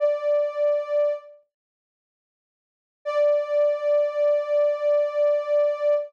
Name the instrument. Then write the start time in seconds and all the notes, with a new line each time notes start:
ocarina
0.00 D5
3.05 D5